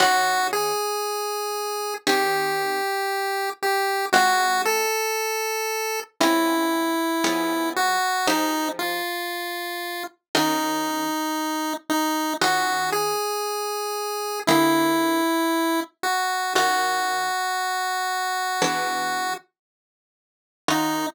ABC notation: X:1
M:4/4
L:1/8
Q:1/4=58
K:Ebdor
V:1 name="Lead 1 (square)"
G A3 =G3 G | G =A3 =E3 G | E F3 E3 E | G A3 =E3 G |
G6 z2 | E2 z6 |]
V:2 name="Orchestral Harp"
[E,DFG]4 [E,C=GA]4 | [A,CFG]4 [A,CDF]2 [F,_CDA]2 | [F,E=GA]4 [E,DF_G]4 | [E,DFG]4 [=D,B,=GA]4 |
[E,DFG]4 [=E,=B,=D^G]4 | [E,DFG]2 z6 |]